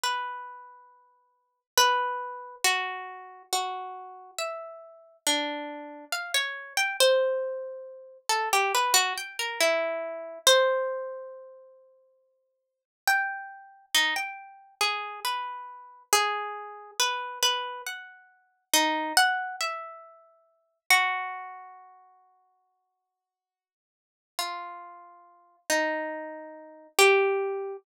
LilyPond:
\new Staff { \time 4/4 \tempo 4 = 69 b'2 b'4 ges'4 | ges'4 e''4 d'4 f''16 des''8 g''16 | c''4. a'16 g'16 b'16 ges'16 g''16 bes'16 e'4 | c''2. g''4 |
ees'16 g''8. aes'8 b'4 aes'4 b'8 | b'8 ges''4 ees'8 ges''8 e''4. | ges'1 | f'4. ees'4. g'4 | }